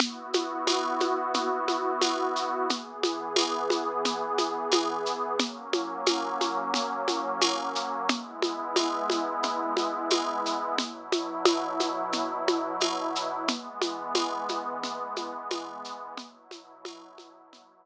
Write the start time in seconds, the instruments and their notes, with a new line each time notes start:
0.00 pad 2 (warm) B3 E4 F#4, low conga, shaker
0.33 high conga, shaker
0.67 tambourine, high conga, shaker
1.00 high conga, shaker
1.34 low conga, shaker
1.68 high conga, shaker
2.01 tambourine, high conga, shaker
2.36 shaker
2.69 pad 2 (warm) E3 B3 G#4, low conga, shaker
3.03 high conga, shaker
3.36 tambourine, high conga, shaker
3.70 high conga, shaker
4.05 low conga, shaker
4.38 high conga, shaker
4.72 tambourine, high conga, shaker
5.06 shaker
5.39 pad 2 (warm) F#3 A#3 C#4, low conga, shaker
5.73 high conga, shaker
6.06 tambourine, high conga, shaker
6.41 high conga, shaker
6.74 low conga, shaker
7.08 high conga, shaker
7.41 tambourine, high conga, shaker
7.75 shaker
8.09 pad 2 (warm) G#3 B3 E4, low conga, shaker
8.42 high conga, shaker
8.76 tambourine, high conga, shaker
9.10 high conga, shaker
9.43 low conga, shaker
9.77 high conga, shaker
10.10 tambourine, high conga, shaker
10.46 shaker
10.78 pad 2 (warm) B2 F#3 E4, low conga, shaker
11.12 high conga, shaker
11.45 tambourine, high conga, shaker
11.80 high conga, shaker
12.12 low conga, shaker
12.48 high conga, shaker
12.80 tambourine, high conga, shaker
13.15 shaker
13.48 pad 2 (warm) E3 G#3 B3, low conga, shaker
13.82 high conga, shaker
14.15 tambourine, high conga, shaker
14.49 high conga, shaker
14.83 low conga, shaker
15.16 high conga, shaker
15.51 tambourine, high conga, shaker
15.85 shaker
16.17 pad 2 (warm) B2 F#3 E4, low conga, shaker
16.51 high conga, shaker
16.85 tambourine, high conga, shaker
17.18 high conga, shaker
17.53 low conga, shaker